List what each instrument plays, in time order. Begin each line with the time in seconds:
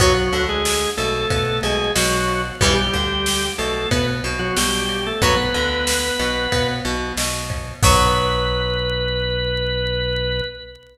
0.00 synth bass 1 B1, drawbar organ F#3 F#4, acoustic guitar (steel) F#3 B3, kick, ride
0.31 synth bass 1 D2, acoustic guitar (steel) D3, ride
0.49 drawbar organ G#3 G#4
0.65 snare
0.97 synth bass 1 B1, acoustic guitar (steel) B2, drawbar organ A3 A4, ride
1.30 synth bass 1 B2, acoustic guitar (steel) B3, kick, ride
1.63 synth bass 1 B1, acoustic guitar (steel) B2, drawbar organ G#3 G#4, ride
1.95 synth bass 1 B1, acoustic guitar (steel) B2, drawbar organ F#3 F#4, snare
2.28 ride
2.61 synth bass 1 B1, acoustic guitar (steel) E3 G3 B3, drawbar organ G3 G4, kick, ride
2.93 synth bass 1 D2, acoustic guitar (steel) D3, kick, ride
3.26 snare
3.58 synth bass 1 B1, acoustic guitar (steel) B2, drawbar organ A3 A4, ride
3.91 synth bass 1 B2, acoustic guitar (steel) B3, drawbar organ B3 B4, kick, ride
4.24 synth bass 1 B1, acoustic guitar (steel) B2, ride
4.39 drawbar organ F#3 F#4
4.57 synth bass 1 B1, acoustic guitar (steel) B2, drawbar organ G3 G4, snare
4.89 ride
5.07 drawbar organ A3 A4
5.22 synth bass 1 B1, acoustic guitar (steel) F#3 B3, drawbar organ B3 B4, kick, ride
5.54 synth bass 1 D2, acoustic guitar (steel) D3, ride
5.87 snare
6.19 synth bass 1 B1, acoustic guitar (steel) B2, ride
6.52 synth bass 1 B2, acoustic guitar (steel) B3, kick, ride
6.85 synth bass 1 B1, acoustic guitar (steel) B2, ride
7.16 synth bass 1 B1, acoustic guitar (steel) B2, snare
7.50 kick, ride
7.83 synth bass 1 B1, acoustic guitar (steel) F#3 B3, drawbar organ B4, kick, crash